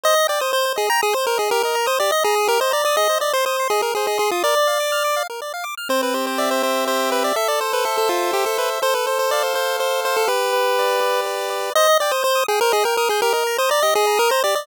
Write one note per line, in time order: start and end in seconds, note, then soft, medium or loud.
0.03 0.14 C5 medium
0.03 0.27 D#5 loud
0.16 0.27 D#5 medium
0.28 0.41 D5 medium
0.28 0.39 G5 medium
0.40 0.52 C5 medium
0.40 0.51 D#6 medium
0.53 0.73 C5 loud
0.53 0.65 G6 medium
0.65 0.76 C5 medium
0.76 0.89 G#4 loud
0.76 0.87 D#5 medium
0.90 1.01 G5 medium
0.90 1.01 A#5 loud
1.02 1.14 G#4 loud
1.02 1.13 D#6 medium
1.13 1.26 C5 loud
1.13 1.24 G6 medium
1.26 1.38 A#4 loud
1.26 1.37 C5 medium
1.38 1.50 G#4 loud
1.38 1.48 D#5 medium
1.51 1.62 G4 medium
1.51 1.63 A#4 loud
1.63 1.87 A#4 medium
1.63 1.76 D#5 medium
1.75 1.86 A#5 medium
1.86 1.99 C5 loud
1.86 1.97 D#6 medium
1.99 2.11 G4 medium
1.99 2.11 D5 loud
2.10 2.21 D#5 medium
2.10 2.23 D#5 loud
2.24 2.48 G#4 loud
2.24 2.35 A#5 medium
2.36 2.47 D#6 medium
2.47 2.58 G4 medium
2.47 2.60 A#4 loud
2.60 2.72 C5 loud
2.60 2.71 D#5 medium
2.71 2.84 D5 loud
2.71 2.82 A#5 medium
2.85 2.96 D5 loud
2.85 2.97 D#6 medium
2.97 3.08 G#4 medium
2.97 3.18 D#5 loud
3.09 3.20 C5 medium
3.20 3.33 D5 loud
3.20 3.31 D#5 medium
3.33 3.45 C5 loud
3.33 3.45 C6 medium
3.46 3.68 C5 medium
3.46 3.57 D#6 medium
3.60 3.71 C6 medium
3.70 3.82 G#4 loud
3.70 3.82 D#5 medium
3.81 3.92 G#4 medium
3.81 3.94 A#4 medium
3.95 4.06 G#4 medium
3.95 4.07 C5 medium
4.07 4.18 G#4 medium
4.07 4.18 D#5 medium
4.18 4.31 G#4 loud
4.18 4.29 C6 medium
4.31 4.43 F4 medium
4.31 4.43 D#6 medium
4.43 4.55 A#4 medium
4.43 5.23 D5 loud
4.57 4.68 D5 medium
4.67 4.78 F5 medium
4.80 4.91 D6 medium
4.92 5.03 F6 medium
5.04 5.15 D6 medium
5.16 5.27 F5 medium
5.30 5.41 A#4 medium
5.42 5.53 D5 medium
5.54 5.65 F5 medium
5.64 5.75 D6 medium
5.77 5.88 F6 medium
5.89 6.62 C4 medium
5.89 6.01 C5 loud
6.03 6.14 B4 medium
6.14 6.86 G4 medium
6.14 6.26 C5 medium
6.27 6.38 C5 medium
6.38 6.50 D5 medium
6.38 7.12 E5 medium
6.51 6.63 C5 medium
6.63 7.32 C4 medium
6.63 6.85 C5 medium
6.87 7.33 G4 medium
6.87 7.10 C5 medium
7.12 7.23 B4 medium
7.12 7.35 E5 medium
7.24 7.36 D5 medium
7.36 8.09 A4 medium
7.36 7.48 E5 loud
7.48 7.60 D5 loud
7.60 8.33 C5 medium
7.60 7.72 C5 medium
7.73 7.85 B4 medium
7.85 7.97 A4 medium
7.85 8.58 E5 medium
7.98 8.09 A4 medium
8.09 8.31 F4 medium
8.09 8.79 A4 medium
8.33 8.45 G4 medium
8.33 8.80 C5 medium
8.46 8.58 A4 medium
8.58 8.70 B4 medium
8.58 8.81 E5 medium
8.82 9.53 A4 medium
8.82 8.94 C5 loud
8.94 9.06 B4 medium
9.07 9.18 C5 medium
9.07 9.79 C5 medium
9.19 9.31 C5 medium
9.31 9.43 D5 loud
9.31 10.05 F5 medium
9.43 9.55 C5 medium
9.54 10.23 A4 medium
9.54 9.77 C5 medium
9.79 10.26 C5 medium
9.79 10.01 C5 medium
10.05 10.16 C5 medium
10.05 10.29 F5 medium
10.17 10.28 A4 loud
10.27 11.00 G4 medium
10.27 11.21 B4 loud
10.53 11.26 B4 medium
10.79 11.49 D5 medium
11.01 11.70 G4 medium
11.26 11.72 B4 medium
11.50 11.73 D5 medium
11.75 11.87 C5 medium
11.75 11.98 D#5 loud
11.89 12.00 D#5 medium
12.00 12.12 D5 loud
12.00 12.12 G5 medium
12.11 12.23 C5 medium
12.11 12.22 D#6 medium
12.23 12.44 C5 loud
12.23 12.34 G6 medium
12.35 12.46 D#6 medium
12.48 12.60 G#4 loud
12.48 12.60 G5 medium
12.61 12.72 A#4 loud
12.61 12.73 C5 medium
12.72 12.85 G#4 loud
12.72 12.83 D#5 medium
12.84 12.97 A#4 loud
12.84 12.95 G5 medium
12.97 13.09 A#4 loud
12.97 13.08 D#6 medium
13.09 13.21 G#4 loud
13.09 13.21 G6 medium
13.22 13.33 G4 medium
13.22 13.33 A#4 loud
13.33 13.57 A#4 loud
13.33 13.44 D#5 medium
13.47 13.58 A#5 medium
13.58 13.70 C5 loud
13.58 13.70 D#6 medium
13.69 13.82 D5 loud
13.69 13.80 A#5 medium
13.83 13.94 G4 medium
13.83 13.94 D#5 loud
13.95 14.19 G#4 loud
13.95 14.06 D#5 medium
14.07 14.18 A#5 medium
14.17 14.31 A#4 loud
14.17 14.28 D#6 medium
14.30 14.43 C5 loud
14.30 14.41 A#5 medium
14.44 14.55 G4 medium
14.44 14.55 D5 loud
14.55 14.66 D5 loud
14.55 14.66 D#5 medium